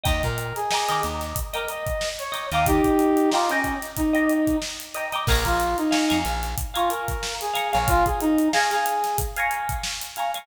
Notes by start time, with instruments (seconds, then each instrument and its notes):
0.04 electric bass (finger) D#2, pizzicato strings D#5 G5 A#5 D6, brass section D#5, kick, closed hi-hat
0.23 electric bass (finger) A#2, brass section A#4, kick, closed hi-hat
0.38 closed hi-hat
0.56 brass section G#4, snare, closed hi-hat
0.71 pizzicato strings D#5 G5 A#5, snare
0.75 pizzicato strings D6
0.89 electric bass (finger) D#3, pizzicato strings D#5 G5 A#5 D6, closed hi-hat
1.03 electric bass (finger) D#2, closed hi-hat
1.21 snare, closed hi-hat
1.36 kick, closed hi-hat
1.53 brass section A#4, pizzicato strings D#5 G5 A#5 D6, closed hi-hat
1.68 brass section D#5, closed hi-hat
1.87 kick, closed hi-hat
2.01 snare
2.19 brass section C#5, closed hi-hat
2.32 pizzicato strings D#5 G5 A#5 D6, snare, closed hi-hat
2.52 electric bass (finger) D#2, pizzicato strings D#5 G5 A#5 D6, brass section F5, snare, closed hi-hat
2.66 brass section D#4 G4, kick, closed hi-hat
2.84 kick, closed hi-hat
2.99 closed hi-hat
3.17 closed hi-hat
3.32 brass section F4, pizzicato strings D#5 G5 A#5, snare
3.36 pizzicato strings D6
3.49 brass section C#4, pizzicato strings D#5 G5 A#5 D6, closed hi-hat
3.64 kick, closed hi-hat
3.82 snare, closed hi-hat
3.97 brass section D#4, kick, closed hi-hat
4.13 pizzicato strings D#5 G5 A#5 D6, closed hi-hat
4.29 closed hi-hat
4.47 kick, closed hi-hat
4.62 snare
4.80 closed hi-hat
4.95 pizzicato strings D#5 G5 A#5 D6, closed hi-hat
5.13 pizzicato strings D#5 G5 A#5 D6, snare, closed hi-hat
5.27 electric bass (finger) A#1, brass section A#4, pizzicato strings F5 G#5 A#5, kick, crash
5.32 pizzicato strings C#6
5.45 electric bass (finger) A#1, brass section F4, kick, closed hi-hat
5.60 closed hi-hat
5.78 brass section D#4, closed hi-hat
5.91 pizzicato strings F5 G#5 A#5 C#6, snare
6.09 electric bass (finger) F2, pizzicato strings F5 G#5 A#5 C#6, closed hi-hat
6.25 electric bass (finger) A#1, closed hi-hat
6.43 snare, closed hi-hat
6.58 kick, closed hi-hat
6.74 brass section F4, pizzicato strings F5 G#5 A#5 C#6, closed hi-hat
6.90 brass section A#4, closed hi-hat
7.08 kick, snare, closed hi-hat
7.23 snare
7.41 brass section G#4, snare, closed hi-hat
7.54 pizzicato strings F5 G#5 A#5 C#6, closed hi-hat
7.73 electric bass (finger) A#1, brass section C#5, pizzicato strings F5 G#5 A#5 C#6, closed hi-hat
7.88 brass section F4, kick, closed hi-hat
8.06 brass section G#4, kick, closed hi-hat
8.21 brass section D#4, closed hi-hat
8.38 closed hi-hat
8.53 brass section G#4, pizzicato strings F5 G#5 A#5 C#6, snare
8.71 brass section G#4, pizzicato strings F5 G#5 A#5 C#6, snare, closed hi-hat
8.86 closed hi-hat
9.04 snare, closed hi-hat
9.18 kick, closed hi-hat
9.37 pizzicato strings F5 G#5 A#5 C#6, closed hi-hat
9.51 closed hi-hat
9.69 kick, closed hi-hat
9.83 snare
10.01 closed hi-hat
10.16 pizzicato strings F5 G#5 A#5 C#6, closed hi-hat
10.34 pizzicato strings F5 G#5 A#5 C#6, closed hi-hat